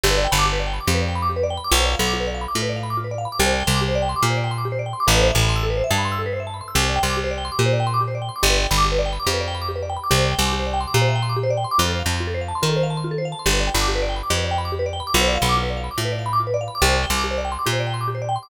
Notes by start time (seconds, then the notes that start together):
0.03 G1 G4
0.11 B4
0.18 D5
0.24 G5
0.32 G1 B5
0.39 D6
0.45 G4
0.53 B4
0.59 D5
0.67 G5
0.73 B5
0.80 D6
0.87 F2 G4
0.95 B4
1.01 D5
1.09 G5
1.15 B5
1.22 D6
1.29 G4
1.36 B4
1.43 D5
1.50 G5
1.57 B5
1.64 D6
1.71 B1 F4
1.78 C5
1.85 D5
1.92 F5
1.99 B1 B5
2.06 D6
2.13 F4
2.20 B4
2.27 D5
2.34 F5
2.41 B5
2.48 D6
2.55 A2 F4
2.62 B4
2.69 D5
2.76 F5
2.83 B5
2.90 D6
2.97 F4
3.04 B4
3.11 D5
3.18 F5
3.25 B5
3.32 D6
3.39 C2 G4
3.46 C5
3.53 D5
3.60 G5
3.67 C2 C6
3.74 D6
3.81 G4
3.88 C5
3.95 D5
4.02 G5
4.09 C6
4.16 D6
4.23 A#2 G4
4.30 C5
4.37 D5
4.44 G5
4.51 C6
4.58 D6
4.65 G4
4.72 C5
4.79 D5
4.86 G5
4.93 C6
5.00 D6
5.07 A1 A4
5.14 B4
5.21 C5
5.28 E5
5.35 A1 A5
5.42 B5
5.49 C6
5.56 E6
5.63 A4
5.70 B4
5.77 C5
5.84 E5
5.91 G2 A5
5.98 B5
6.05 C6
6.12 E6
6.19 A4
6.26 B4
6.33 C5
6.40 E5
6.47 A5
6.54 B5
6.61 C6
6.68 E6
6.75 C2 G4
6.82 C5
6.89 D5
6.96 G5
7.03 C2 C6
7.10 D6
7.17 G4
7.24 C5
7.31 D5
7.38 G5
7.45 C6
7.52 D6
7.59 A#2 G4
7.66 C5
7.73 D5
7.80 G5
7.87 C6
7.94 D6
8.01 G4
8.08 C5
8.15 D5
8.22 G5
8.29 C6
8.36 D6
8.43 G1 G4
8.50 B4
8.57 D5
8.64 G5
8.71 G1 B5
8.78 D6
8.85 G4
8.92 B4
8.99 D5
9.06 G5
9.13 B5
9.20 D6
9.27 F2 G4
9.34 B4
9.41 D5
9.48 G5
9.55 B5
9.62 D6
9.69 G4
9.76 B4
9.83 D5
9.90 G5
9.97 B5
10.04 D6
10.11 C2 G4
10.18 C5
10.24 D5
10.32 G5
10.39 C2 C6
10.45 D6
10.53 G4
10.59 C5
10.66 D5
10.73 G5
10.81 C6
10.87 D6
10.94 A#2 G4
11.01 C5
11.08 E5
11.15 G5
11.22 C6
11.29 D6
11.36 G4
11.43 C5
11.50 D5
11.57 G5
11.64 C6
11.71 D6
11.78 F2 F4
11.85 A4
11.92 C5
11.99 F5
12.06 F2 A5
12.13 C6
12.20 F4
12.27 A4
12.34 C5
12.41 F5
12.48 A5
12.55 C6
12.62 D#3 F4
12.69 A4
12.76 C5
12.83 F5
12.90 A5
12.97 C6
13.04 F4
13.11 A4
13.18 C5
13.25 F5
13.32 A5
13.39 C6
13.46 G1 G4
13.53 B4
13.60 D5
13.67 G5
13.74 G1 B5
13.81 D6
13.88 G4
13.95 B4
14.02 D5
14.09 G5
14.16 B5
14.23 D6
14.30 F2 G4
14.37 B4
14.44 D5
14.51 G5
14.58 B5
14.65 D6
14.72 G4
14.79 B4
14.86 D5
14.93 G5
15.00 B5
15.07 D6
15.14 B1 F4
15.21 C5
15.28 D5
15.35 F5
15.42 B1 B5
15.49 D6
15.56 F4
15.63 B4
15.70 D5
15.77 F5
15.84 B5
15.91 D6
15.98 A2 F4
16.05 B4
16.12 D5
16.19 F5
16.26 B5
16.33 D6
16.40 F4
16.47 B4
16.54 D5
16.61 F5
16.68 B5
16.75 D6
16.82 C2 G4
16.89 C5
16.96 D5
17.03 G5
17.10 C2 C6
17.17 D6
17.24 G4
17.31 C5
17.38 D5
17.45 G5
17.52 C6
17.59 D6
17.66 A#2 G4
17.73 C5
17.80 D5
17.87 G5
17.94 C6
18.01 D6
18.08 G4
18.15 C5
18.22 D5
18.29 G5
18.36 C6
18.43 D6